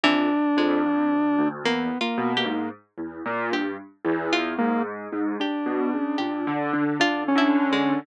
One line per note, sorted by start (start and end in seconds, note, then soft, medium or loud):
0.04 0.28 F2 medium
0.04 0.52 E3 loud
0.04 1.48 D4 loud
0.57 0.81 F2 loud
0.57 1.54 G#3 medium
0.84 1.08 F2 medium
1.12 1.36 D2 medium
1.39 1.63 D2 medium
1.64 1.88 E2 medium
1.64 1.98 A#3 loud
1.64 1.98 B3 medium
2.01 2.33 A#3 medium
2.01 2.33 F4 loud
2.18 2.42 B2 loud
2.37 2.69 A#3 medium
2.37 2.69 G4 medium
2.45 2.69 G#2 medium
2.98 3.22 E2 medium
3.26 3.50 A#2 loud
3.52 3.76 G2 medium
3.52 3.77 G4 medium
4.05 4.53 E2 loud
4.33 5.29 F4 loud
4.58 5.08 G#2 medium
4.58 4.82 A#3 loud
5.13 5.37 G#2 medium
5.40 6.84 D4 medium
5.40 6.13 G4 medium
5.66 5.90 B2 medium
5.93 6.17 C#3 medium
6.18 6.44 A#2 medium
6.18 6.42 G4 medium
6.47 6.71 D3 loud
6.73 6.97 D3 medium
7.00 7.32 D3 medium
7.00 7.24 D4 medium
7.00 7.33 F4 loud
7.28 8.00 C#4 loud
7.35 7.68 D3 loud
7.35 7.70 E4 medium
7.72 8.04 D3 medium
7.72 8.05 G#3 medium